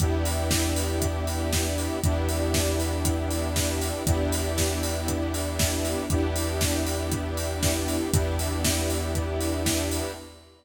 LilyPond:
<<
  \new Staff \with { instrumentName = "Lead 2 (sawtooth)" } { \time 4/4 \key e \minor \tempo 4 = 118 <b d' e' g'>1 | <b d' e' g'>1 | <b d' e' g'>1 | <b d' e' g'>1 |
<b d' e' g'>1 | }
  \new Staff \with { instrumentName = "Synth Bass 2" } { \clef bass \time 4/4 \key e \minor e,1 | e,1 | e,1 | e,1 |
e,1 | }
  \new Staff \with { instrumentName = "String Ensemble 1" } { \time 4/4 \key e \minor <b d' e' g'>1 | <b d' e' g'>1 | <b d' e' g'>1 | <b d' e' g'>1 |
<b d' e' g'>1 | }
  \new DrumStaff \with { instrumentName = "Drums" } \drummode { \time 4/4 <hh bd>8 hho8 <bd sn>8 hho8 <hh bd>8 hho8 <bd sn>8 hho8 | <hh bd>8 hho8 <bd sn>8 hho8 <hh bd>8 hho8 <bd sn>8 hho8 | <hh bd>8 hho8 <bd sn>8 hho8 <hh bd>8 hho8 <bd sn>8 hho8 | <hh bd>8 hho8 <bd sn>8 hho8 <hh bd>8 hho8 <bd sn>8 hho8 |
<hh bd>8 hho8 <bd sn>8 hho8 <hh bd>8 hho8 <bd sn>8 hho8 | }
>>